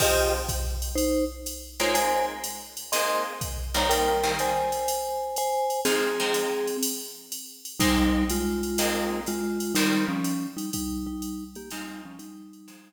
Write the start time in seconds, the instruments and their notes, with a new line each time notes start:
0.00 acoustic guitar (steel) F3 C4 D#4 G#4, vibraphone G4 D#5, kick, crash, ride
0.49 kick, hi-hat pedal, ride
0.82 ride
0.95 vibraphone D#4 C5, ride
1.46 hi-hat pedal, ride
1.80 acoustic guitar (steel) G#3 A#3 C4 D#4, vibraphone F4 C#5, ride
1.94 vibraphone C5 G#5, ride
2.44 hi-hat pedal, ride
2.77 ride
2.92 acoustic guitar (steel) G#3 A#3 C4 D#4, vibraphone D#5 C6, ride
3.41 kick, hi-hat pedal, ride
3.74 acoustic guitar (steel) D#3 G3 A#3 C4, vibraphone C#5 A#5, ride
3.89 vibraphone A#4 G5, ride
4.23 acoustic guitar (steel) D#3 G3 A#3 C4
4.39 vibraphone C5 G#5, hi-hat pedal, ride
4.72 ride
4.88 ride
5.36 vibraphone C5 G#5, hi-hat pedal, ride
5.70 ride
5.85 acoustic guitar (steel) F3 G#3 C4 D#4, vibraphone C4 G#4, ride
6.20 acoustic guitar (steel) F3 G#3 C4 D#4
6.34 hi-hat pedal, ride
6.67 ride
6.83 ride
7.32 hi-hat pedal, ride
7.65 ride
7.80 vibraphone G3 D#4, acoustic guitar (steel) G#3 A#3 C4 D#4, kick, ride
8.29 vibraphone G#3 F4, hi-hat pedal, ride
8.63 ride
8.78 acoustic guitar (steel) G#3 A#3 C4 D#4, ride
9.26 vibraphone G#3 F4, hi-hat pedal, ride
9.60 ride
9.75 acoustic guitar (steel) D#3 G3 A#3 C4, vibraphone G3 D#4, ride
10.08 vibraphone F3 C#4
10.24 hi-hat pedal, ride
10.57 vibraphone G3 D#4, ride
10.73 vibraphone G3 D#4, kick, ride
11.07 vibraphone G3 D#4
11.22 hi-hat pedal, ride
11.55 vibraphone A#3 G4, ride
11.71 acoustic guitar (steel) F3 G#3 C4 D#4, vibraphone G3 D#4, ride
12.05 vibraphone F3 C#4
12.19 vibraphone G3 D#4, hi-hat pedal, ride
12.53 ride
12.68 acoustic guitar (steel) F3 G#3 C4 D#4, ride